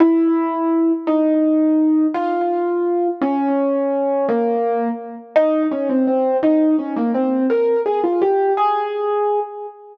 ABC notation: X:1
M:6/8
L:1/8
Q:3/8=112
K:Ab
V:1 name="Acoustic Grand Piano"
=E6 | E6 | F6 | D6 |
B,4 z2 | E2 D C C2 | E2 D B, C2 | B2 A F G2 |
A5 z |]